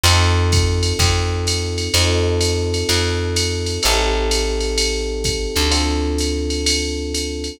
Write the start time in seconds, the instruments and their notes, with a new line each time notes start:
0.03 electric bass (finger) F2, electric piano 1 C4 D#4 F4 A4, ride
0.52 kick, hi-hat pedal, ride
0.83 ride
0.99 electric bass (finger) F2, kick, ride
1.47 hi-hat pedal, ride
1.78 ride
1.94 electric bass (finger) F2, electric piano 1 C4 D#4 F4 A4, ride
2.41 hi-hat pedal, ride
2.74 ride
2.89 electric bass (finger) F2, ride
3.36 hi-hat pedal, ride
3.66 ride
3.83 electric bass (finger) A1, electric piano 1 C4 D#4 G4 A4, ride
4.31 hi-hat pedal, ride
4.60 ride
4.78 ride
5.24 kick, hi-hat pedal, ride
5.56 electric bass (finger) D2, ride
5.71 electric piano 1 C4 D4 F4 A4, ride
6.18 hi-hat pedal, ride
6.50 ride
6.66 ride
7.14 hi-hat pedal, ride
7.44 ride